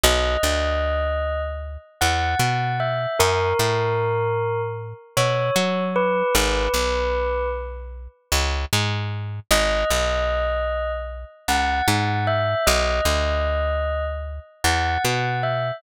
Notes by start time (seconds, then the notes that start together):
0.04 B1 D#5
0.43 D2
2.01 E2 F#5
2.39 B2
2.80 E5
3.19 F#2 A#4
3.59 A2
5.17 B2 C#5
5.56 F#3
5.96 B4
6.35 G#1 B4
6.74 B1
8.32 C#2
8.73 G#2
9.51 G#1 D#5
9.90 B1
11.48 C#2 F#5
11.88 G#2
12.27 E5
12.67 B1 D#5
13.05 D2
14.64 E2 F#5
15.05 B2
15.43 E5